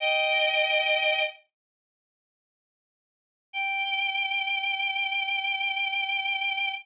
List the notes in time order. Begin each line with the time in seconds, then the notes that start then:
0.00 D#5 G5
3.53 G5